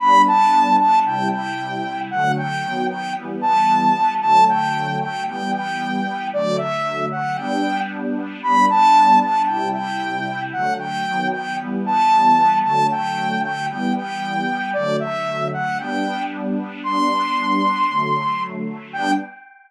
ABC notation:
X:1
M:4/4
L:1/8
Q:1/4=114
K:G
V:1 name="Lead 2 (sawtooth)"
b a2 a g g3 | f g2 g z a3 | a g2 g g g3 | d e2 f g2 z2 |
b a2 a g g3 | f g2 g z a3 | a g2 g g g3 | d e2 f g2 z2 |
c'7 z | g2 z6 |]
V:2 name="Pad 2 (warm)"
[G,B,D]4 [C,G,E]4 | [D,F,A,]2 [^D,F,B,]2 [E,G,B,]4 | [D,F,A,]4 [E,G,B,]4 | [D,F,A,]4 [G,B,D]4 |
[G,B,D]4 [C,G,E]4 | [D,F,A,]2 [^D,F,B,]2 [E,G,B,]4 | [D,F,A,]4 [E,G,B,]4 | [D,F,A,]4 [G,B,D]4 |
[G,B,D]4 [D,F,A,]4 | [G,B,D]2 z6 |]